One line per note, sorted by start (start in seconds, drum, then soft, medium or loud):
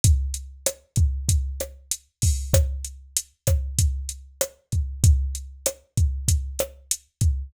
0.04 kick medium
0.04 closed hi-hat loud
0.34 closed hi-hat medium
0.66 cross-stick medium
0.66 closed hi-hat medium
0.96 kick medium
0.96 closed hi-hat medium
1.29 kick medium
1.29 closed hi-hat medium
1.60 cross-stick medium
1.60 closed hi-hat medium
1.91 closed hi-hat medium
2.22 kick medium
2.22 open hi-hat medium
2.53 kick medium
2.53 cross-stick medium
2.53 closed hi-hat medium
2.85 closed hi-hat medium
3.17 closed hi-hat medium
3.47 kick medium
3.47 cross-stick medium
3.47 closed hi-hat medium
3.79 kick medium
3.79 closed hi-hat medium
4.09 closed hi-hat medium
4.41 cross-stick medium
4.41 closed hi-hat medium
4.72 kick medium
4.72 closed hi-hat soft
5.04 kick medium
5.04 closed hi-hat medium
5.35 closed hi-hat medium
5.66 cross-stick medium
5.66 closed hi-hat medium
5.97 kick medium
5.97 closed hi-hat medium
6.28 kick medium
6.28 closed hi-hat medium
6.59 cross-stick medium
6.59 closed hi-hat medium
6.91 closed hi-hat medium
7.21 kick medium
7.21 closed hi-hat medium